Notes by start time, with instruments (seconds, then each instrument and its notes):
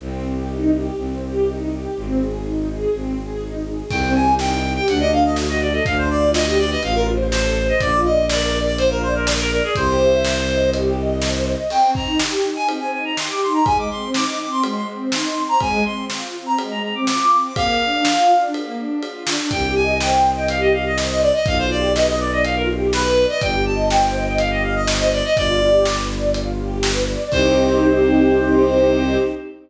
0.00 violin C2, string ensemble 1 C4
0.24 string ensemble 1 G4
0.49 string ensemble 1 D#4
0.73 string ensemble 1 G4
0.96 violin C2, string ensemble 1 C4
1.22 string ensemble 1 G4
1.47 string ensemble 1 D#4
1.70 string ensemble 1 G4
1.96 violin G#1, string ensemble 1 C4
2.20 string ensemble 1 G#4
2.44 string ensemble 1 D#4
2.68 string ensemble 1 G#4
2.92 violin G#1, string ensemble 1 C4
3.17 string ensemble 1 G#4
3.41 string ensemble 1 D#4
3.65 string ensemble 1 G#4
3.89 violin C2, string ensemble 1 C4, clarinet G5, kick, crash
4.15 string ensemble 1 G4, clarinet G#5
4.39 string ensemble 1 D#4, clarinet G5, snare
4.63 string ensemble 1 G4
4.76 clarinet G5
4.88 violin D2, string ensemble 1 D4, clarinet F#5, closed hi-hat
5.00 clarinet D#5
5.11 string ensemble 1 A4, clarinet F5
5.24 clarinet D#5
5.36 string ensemble 1 F#4, snare
5.49 clarinet D#5
5.61 string ensemble 1 A4, clarinet D5
5.73 clarinet D#5
5.85 violin D2, string ensemble 1 D4, clarinet F5, kick, closed hi-hat
5.98 clarinet C5
6.10 string ensemble 1 F4, clarinet D5
6.34 string ensemble 1 G4, clarinet D#5, snare
6.46 clarinet D#5
6.58 string ensemble 1 B4, clarinet D5
6.71 clarinet D#5
6.82 violin A1, string ensemble 1 F4, clarinet F5, closed hi-hat
6.95 clarinet A#4
7.06 string ensemble 1 C5
7.32 string ensemble 1 A4, clarinet C5, snare
7.56 string ensemble 1 C5
7.69 clarinet D#5
7.80 violin A#1, string ensemble 1 F4, clarinet D5, kick, closed hi-hat
8.05 string ensemble 1 D5, clarinet D#5
8.29 string ensemble 1 A#4, clarinet D5, snare
8.55 string ensemble 1 D5
8.66 clarinet D5
8.77 string ensemble 1 F4, clarinet C5, closed hi-hat
8.90 clarinet A#4
9.02 clarinet C5, string ensemble 1 D5
9.15 clarinet A#4
9.27 string ensemble 1 A#4, snare
9.39 clarinet A#4
9.51 clarinet A#4, string ensemble 1 D5
9.64 clarinet G#4
9.75 violin C2, string ensemble 1 G4, clarinet C5, kick, closed hi-hat
10.01 string ensemble 1 E5
10.23 string ensemble 1 C5, snare
10.49 string ensemble 1 D#5
10.73 string ensemble 1 G4, closed hi-hat
10.97 string ensemble 1 D#5
11.22 string ensemble 1 C5, snare
11.46 string ensemble 1 D#5
11.70 string ensemble 1 C4, clarinet G5, crash
11.95 string ensemble 1 D#4, clarinet A#5, kick
12.19 string ensemble 1 G4, snare
12.44 string ensemble 1 D#4
12.56 clarinet G#5
12.68 string ensemble 1 C4, ride
12.81 clarinet G#5
12.93 string ensemble 1 D#4, clarinet G#5
13.05 clarinet A#5
13.17 string ensemble 1 G4, clarinet C6, snare
13.30 clarinet D6
13.42 string ensemble 1 D#4, clarinet C6
13.54 clarinet A#5
13.66 string ensemble 1 G#3, clarinet G#5, kick, ride
13.78 clarinet D6
13.90 string ensemble 1 C4, clarinet C6
14.14 string ensemble 1 D#4, clarinet D6, snare
14.27 clarinet D6
14.39 string ensemble 1 C4, clarinet D6
14.51 clarinet C6
14.63 string ensemble 1 G#3, ride
14.76 clarinet C6
14.88 string ensemble 1 C4
15.11 string ensemble 1 D#4, clarinet C6, snare
15.36 string ensemble 1 C4
15.49 clarinet A#5
15.60 string ensemble 1 G#3, clarinet G#5, kick, ride
15.85 string ensemble 1 C4, clarinet C6
16.10 string ensemble 1 F4, snare
16.34 string ensemble 1 C4
16.46 clarinet A#5
16.58 string ensemble 1 G#3, ride
16.71 clarinet A#5
16.83 string ensemble 1 C4, clarinet A#5
16.95 clarinet D6
17.07 string ensemble 1 F4, clarinet D6, snare
17.20 clarinet D6
17.32 string ensemble 1 C4, clarinet D6
17.44 clarinet D6
17.56 string ensemble 1 A#3, clarinet F5, kick, ride
17.81 string ensemble 1 D4
18.05 string ensemble 1 F4, snare
18.30 string ensemble 1 D4
18.54 string ensemble 1 A#3, ride
18.77 string ensemble 1 D4
19.02 string ensemble 1 F4, ride
19.27 string ensemble 1 D4, snare
19.51 violin C2, string ensemble 1 G4, clarinet G5, kick, closed hi-hat
19.75 string ensemble 1 D#5, clarinet G#5
20.00 string ensemble 1 C5, clarinet G5, snare
20.24 string ensemble 1 D#5
20.37 clarinet G5
20.48 string ensemble 1 G4, clarinet F5, closed hi-hat
20.61 clarinet D#5
20.73 string ensemble 1 D#5, clarinet F5
20.85 clarinet D#5
20.97 string ensemble 1 C5, snare
21.10 clarinet D#5
21.22 clarinet D5, string ensemble 1 D#5
21.34 clarinet D#5
21.45 violin B1, string ensemble 1 F4, clarinet F5, kick, closed hi-hat
21.59 clarinet C5
21.70 string ensemble 1 G4, clarinet D5
21.95 string ensemble 1 B4, clarinet D#5, snare
22.07 clarinet D#5
22.19 string ensemble 1 D5, clarinet D5
22.32 clarinet D#5
22.44 string ensemble 1 F4, clarinet F5, closed hi-hat
22.56 clarinet A#4
22.68 string ensemble 1 G4
22.93 string ensemble 1 B4, clarinet B4, snare
23.16 string ensemble 1 D5
23.29 clarinet D#5
23.41 violin G1, string ensemble 1 G4, clarinet G5, kick, closed hi-hat
23.66 string ensemble 1 D#5, clarinet A5
23.89 string ensemble 1 C5, clarinet G5, snare
24.14 string ensemble 1 D#5
24.27 clarinet G5
24.38 string ensemble 1 G4, clarinet F5, closed hi-hat
24.51 clarinet D#5
24.63 string ensemble 1 D#5, clarinet F5
24.75 clarinet D#5
24.87 string ensemble 1 C5, snare
25.00 clarinet D#5
25.12 clarinet D5, string ensemble 1 D#5
25.24 clarinet D#5
25.35 violin G1, string ensemble 1 F4, clarinet D5, kick, closed hi-hat
25.62 string ensemble 1 G4
25.85 string ensemble 1 B4, snare
26.10 string ensemble 1 D5
26.33 string ensemble 1 F4, closed hi-hat
26.58 string ensemble 1 G4
26.83 string ensemble 1 B4, snare
27.08 string ensemble 1 D5
27.31 violin C2, string ensemble 1 C4 D#4 G4, clarinet C5, kick, crash